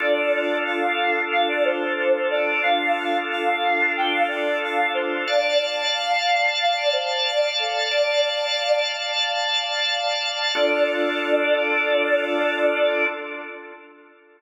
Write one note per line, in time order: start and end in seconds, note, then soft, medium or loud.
0.00 2.61 D4 medium
0.00 2.61 F4 medium
0.00 2.61 A4 medium
0.00 0.57 D5 medium
0.66 1.21 F5 medium
1.32 1.48 F5 medium
1.49 1.64 D5 medium
1.65 1.93 C5 medium
1.98 2.26 C5 medium
2.30 2.62 D5 medium
2.63 5.25 D4 medium
2.63 5.25 F4 medium
2.63 5.25 A4 medium
2.63 3.17 F5 medium
3.31 3.92 F5 medium
3.97 4.13 G5 medium
4.12 4.27 F5 medium
4.28 4.58 D5 medium
4.63 4.91 F5 medium
4.94 5.23 C5 medium
5.27 7.89 D5 medium
5.27 5.90 D5 loud
5.27 7.89 F5 medium
5.27 7.89 A5 medium
5.93 6.50 F5 medium
6.60 6.76 F5 medium
6.77 6.93 D5 medium
6.93 7.25 C5 medium
7.25 7.52 D5 medium
7.59 7.87 A4 medium
7.91 8.80 D5 medium
7.91 10.52 D5 medium
7.91 10.52 F5 medium
7.91 10.52 A5 medium
10.55 13.05 D4 loud
10.55 13.05 F4 medium
10.55 13.05 A4 loud
10.55 13.05 D5 loud